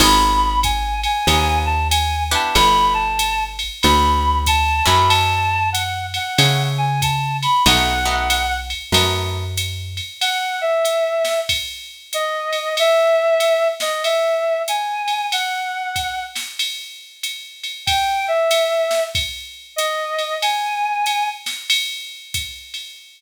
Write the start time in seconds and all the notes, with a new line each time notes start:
0.00 G#1 B3 D#4 F4 G#4 B5, crash, ride
0.63 G#5, kick, hi-hat pedal, ride
1.03 G#5, ride
1.27 D#2 B3 D#4 F4 G#4, ride
1.66 A5
1.90 G#5, hi-hat pedal, ride
2.31 B3 D4 E4 G4 A5, ride
2.55 G1 B5, ride
2.94 A5
3.19 hi-hat pedal, ride
3.59 ride
3.82 D2 B5, ride
4.46 A5, kick, hi-hat pedal, ride
4.86 F#2 A3 C#4 E4 F#4 B5, ride
5.09 A5, ride
5.72 F#5, hi-hat pedal, ride
6.14 F#5, ride
6.38 C#3 A3 C#4 E4 F#4, ride
6.78 G#5
7.02 A5, kick, hi-hat pedal, ride
7.43 B5, ride
7.66 B1 A3 B3 D#4 F#4 F#5, ride
8.05 A3 B3 D#4 F#4
8.30 hi-hat pedal, ride
8.70 ride
8.92 F#2 A3 B3 D#4 F#4, ride
9.57 hi-hat pedal, ride
9.97 ride
10.21 F#5, ride
10.61 E5
10.85 hi-hat pedal, ride
11.25 snare, ride
11.49 kick, ride
12.13 D#5, hi-hat pedal, ride
12.53 ride
12.77 E5, ride
13.40 hi-hat pedal, ride
13.80 D#5, snare, ride
14.04 E5, ride
14.68 G#5, hi-hat pedal, ride
15.08 ride
15.32 F#5, ride
15.96 kick, hi-hat pedal, ride
16.36 snare, ride
16.59 ride
17.23 hi-hat pedal, ride
17.64 ride
17.86 G5, kick, ride
18.28 E5
18.51 hi-hat pedal, ride
18.91 snare, ride
19.15 kick, ride
19.76 D#5, hi-hat pedal, ride
20.18 ride
20.42 G#5, ride
21.06 hi-hat pedal, ride
21.46 snare, ride
21.70 ride
22.34 kick, hi-hat pedal, ride
22.74 ride